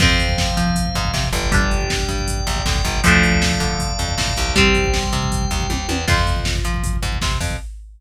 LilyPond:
<<
  \new Staff \with { instrumentName = "Overdriven Guitar" } { \time 4/4 \key f \major \tempo 4 = 158 <f c'>1 | <g d'>1 | <f a d'>1 | <g c'>1 |
<f' c''>1 | }
  \new Staff \with { instrumentName = "Drawbar Organ" } { \time 4/4 \key f \major <c'' f''>2.~ <c'' f''>8 <d'' g''>8~ | <d'' g''>1 | <d'' f'' a''>1 | <c'' g''>1 |
r1 | }
  \new Staff \with { instrumentName = "Electric Bass (finger)" } { \clef bass \time 4/4 \key f \major f,4. f4 aes,8 c8 g,,8~ | g,,4. g,4 bes,,8 d,8 g,,8 | d,4. d4 f,8 a,8 c,8~ | c,4. c4 ees,8 ees,8 e,8 |
f,4. f4 aes,8 c8 f,8 | }
  \new DrumStaff \with { instrumentName = "Drums" } \drummode { \time 4/4 <cymc bd>16 bd16 <hh bd>16 bd16 <bd sn>16 bd16 <hh bd>16 bd16 <hh bd>16 bd16 <hh bd>16 bd16 <bd sn>16 bd16 <hh bd>16 bd16 | <hh bd>16 bd16 <hh bd>16 bd16 <bd sn>16 bd16 <hh bd>16 bd16 <hh bd>16 bd16 <hh bd>16 bd16 <bd sn>16 bd16 <hh bd>16 bd16 | <hh bd>16 bd16 <hh bd>16 bd16 <bd sn>16 bd16 <hh bd>16 bd16 <hh bd>16 bd16 <hh bd>16 bd16 <bd sn>16 bd16 <hh bd>16 bd16 | <hh bd>16 bd16 <hh bd>16 bd16 <bd sn>16 bd16 <hh bd>16 bd16 <hh bd>16 bd16 <hh bd>16 bd16 <bd tommh>8 tommh8 |
<cymc bd>16 bd16 <hh bd>16 bd16 <bd sn>16 bd16 <hh bd>16 bd16 <hh bd>16 bd16 <hh bd>16 bd16 <bd sn>16 bd16 <hho bd>16 bd16 | }
>>